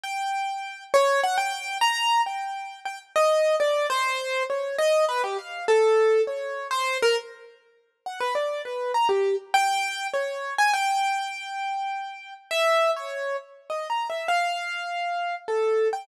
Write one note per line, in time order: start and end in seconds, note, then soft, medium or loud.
0.03 0.84 G5 medium
0.94 1.21 C#5 loud
1.24 1.37 F#5 loud
1.38 1.78 G5 medium
1.81 2.21 A#5 loud
2.26 2.80 G5 medium
2.85 2.99 G5 medium
3.16 3.56 D#5 loud
3.60 3.87 D5 medium
3.90 4.43 C5 loud
4.50 4.76 C#5 medium
4.78 5.05 D#5 loud
5.09 5.22 B4 medium
5.24 5.37 G4 medium
5.38 5.65 F5 medium
5.68 6.22 A4 loud
6.27 6.67 C#5 medium
6.71 6.98 C5 loud
7.02 7.16 A#4 loud
8.06 8.19 F#5 medium
8.20 8.34 B4 medium
8.35 8.62 D5 medium
8.65 8.92 B4 medium
8.94 9.08 A#5 medium
9.09 9.36 G4 medium
9.54 10.07 G5 loud
10.13 10.54 C#5 medium
10.58 10.72 G#5 loud
10.74 12.34 G5 loud
12.51 12.91 E5 loud
12.96 13.37 C#5 medium
13.70 13.88 D#5 medium
13.90 14.08 A#5 medium
14.10 14.27 E5 medium
14.28 15.35 F5 medium
15.48 15.88 A4 medium
15.93 16.06 G5 medium